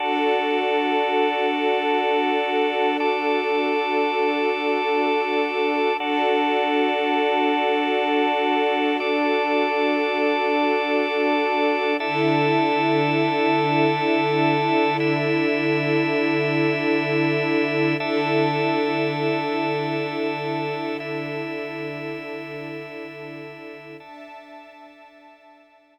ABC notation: X:1
M:3/4
L:1/8
Q:1/4=60
K:Dmix
V:1 name="String Ensemble 1"
[DFA]6- | [DFA]6 | [DFA]6- | [DFA]6 |
[D,EA]6- | [D,EA]6 | [D,EA]6- | [D,EA]6 |
[Dea]6 |]
V:2 name="Drawbar Organ"
[DFA]6 | [DAd]6 | [DFA]6 | [DAd]6 |
[DAe]6 | [DEe]6 | [DAe]6 | [DEe]6 |
[DAe]6 |]